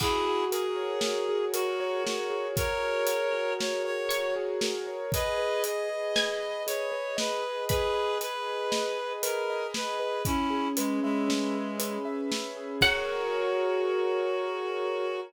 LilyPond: <<
  \new Staff \with { instrumentName = "Pizzicato Strings" } { \time 5/4 \key fis \mixolydian \tempo 4 = 117 r1 r4 | r2. cis''2 | r2 gis''2. | b''1~ b''4 |
r1 r4 | fis''1~ fis''4 | }
  \new Staff \with { instrumentName = "Clarinet" } { \time 5/4 \key fis \mixolydian <e' gis'>4 gis'2 fis'4 fis'4 | <ais' cis''>2 cis''8 cis''4 r4. | <b' dis''>4 dis''2 cis''4 b'4 | <gis' b'>4 b'2 ais'4 b'4 |
<cis' e'>4 gis8 gis2 r4. | fis'1~ fis'4 | }
  \new Staff \with { instrumentName = "Acoustic Grand Piano" } { \time 5/4 \key fis \mixolydian fis'8 gis'8 ais'8 cis''8 fis'8 gis'8 ais'8 cis''8 fis'8 gis'8 | ais'8 cis''8 fis'8 gis'8 ais'8 cis''8 fis'8 gis'8 ais'8 cis''8 | gis'8 b'8 dis''8 gis'8 b'8 dis''8 gis'8 b'8 dis''8 gis'8 | b'8 dis''8 gis'8 b'8 dis''8 gis'8 b'8 dis''8 gis'8 b'8 |
cis'8 gis'8 b'8 e''8 cis'8 gis'8 b'8 e''8 cis'8 gis'8 | <fis' gis' ais' cis''>1~ <fis' gis' ais' cis''>4 | }
  \new DrumStaff \with { instrumentName = "Drums" } \drummode { \time 5/4 <cymc bd>4 hh4 sn4 hh4 sn4 | <hh bd>4 hh4 sn4 hh4 sn4 | <hh bd>4 hh4 sn4 hh4 sn4 | <hh bd>4 hh4 sn4 hh4 sn4 |
<hh bd>4 hh4 sn4 hh4 sn4 | <cymc bd>4 r4 r4 r4 r4 | }
>>